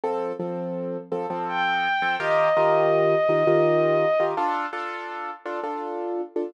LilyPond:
<<
  \new Staff \with { instrumentName = "Violin" } { \time 3/4 \key g \minor \tempo 4 = 83 r2 g''4 | ees''2. | r2. | }
  \new Staff \with { instrumentName = "Acoustic Grand Piano" } { \time 3/4 \key g \minor <f c' a'>8 <f c' a'>4 <f c' a'>16 <f c' a'>4 <f c' a'>16 | <ees f' g' bes'>8 <ees f' g' bes'>4 <ees f' g' bes'>16 <ees f' g' bes'>4 <ees f' g' bes'>16 | <d' f' a'>8 <d' f' a'>4 <d' f' a'>16 <d' f' a'>4 <d' f' a'>16 | }
>>